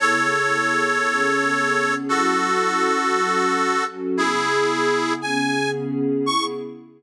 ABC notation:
X:1
M:4/4
L:1/8
Q:1/4=115
K:C#m
V:1 name="Harmonica"
[Ac]8 | [FA]8 | [EG]4 g2 z2 | c'2 z6 |]
V:2 name="Pad 2 (warm)"
[C,B,EG]4 [C,B,CG]4 | [F,CEA]4 [F,CFA]4 | [C,B,EG]4 [C,B,CG]4 | [C,B,EG]2 z6 |]